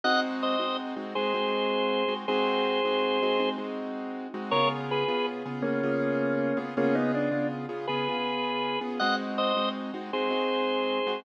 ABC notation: X:1
M:12/8
L:1/8
Q:3/8=107
K:Ab
V:1 name="Drawbar Organ"
[e_g] z [ce]2 z2 [Ac]6 | [Ac]7 z5 | [Bd] z [A_c]2 z2 [B,D]6 | [B,D] [_CE] =D2 z2 [A_c]6 |
[e_g] z [ce]2 z2 [Ac]6 |]
V:2 name="Acoustic Grand Piano"
[A,CE_G]3 [A,CEG]2 [A,CEG] [A,CEG] [A,CEG]4 [A,CEG] | [A,CE_G]3 [A,CEG]2 [A,CEG] [A,CEG] [A,CEG]4 [A,CEG] | [D,_CFA]3 [D,CFA]2 [D,CFA] [D,CFA] [D,CFA]4 [D,CFA] | [D,_CFA]3 [D,CFA]2 [D,CFA] [D,CFA] [D,CFA]4 [D,CFA] |
[A,CE_G]3 [A,CEG]2 [A,CEG] [A,CEG] [A,CEG]4 [A,CEG] |]